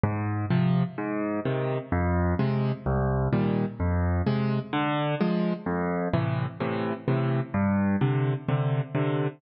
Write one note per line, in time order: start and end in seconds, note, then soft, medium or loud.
0.04 0.46 G#2 medium
0.50 0.83 C3 medium
0.50 0.83 F3 medium
0.98 1.40 G#2 medium
1.45 1.78 C3 medium
1.45 1.78 D#3 medium
1.92 2.34 F2 loud
2.39 2.72 C3 medium
2.39 2.72 G#3 medium
2.86 3.28 C2 medium
3.33 3.65 A#2 medium
3.33 3.65 D#3 medium
3.33 3.65 G3 medium
3.80 4.22 F2 medium
4.27 4.59 C3 medium
4.27 4.59 G#3 medium
4.73 5.15 D3 medium
5.21 5.53 F3 medium
5.21 5.53 G#3 medium
5.66 6.08 F2 medium
6.14 6.46 A2 medium
6.14 6.46 C3 medium
6.14 6.46 E3 medium
6.60 6.93 A2 medium
6.60 6.93 C3 medium
6.60 6.93 E3 medium
7.08 7.41 A2 medium
7.08 7.41 C3 medium
7.08 7.41 E3 medium
7.54 7.96 G2 medium
8.01 8.34 C3 medium
8.01 8.34 D3 medium
8.49 8.81 C3 medium
8.49 8.81 D3 medium
8.95 9.28 C3 medium
8.95 9.28 D3 medium